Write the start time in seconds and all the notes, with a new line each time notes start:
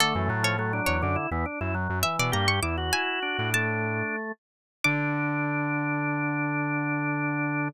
0.00 D3 A3 A4
0.15 F#2 E3
0.29 A2 F#3
0.43 F3 C#5
0.58 F#3 A3
0.73 F#3 D4
0.86 E2 C#5
1.02 F#2 D3 D4
1.16 E4
1.31 E2 E3 B3
1.46 D4
1.61 F#2 E4
1.74 F#3
1.89 F#2
2.03 E3 E5
2.19 B2 D5
2.32 G2 A#3 G4 A#5
2.48 C#6
2.62 E2 E4 D6
2.78 F#4
2.93 E4 G#5
3.22 D4
3.38 A2 D4
3.54 A3 A5
4.84 D3 D4 D6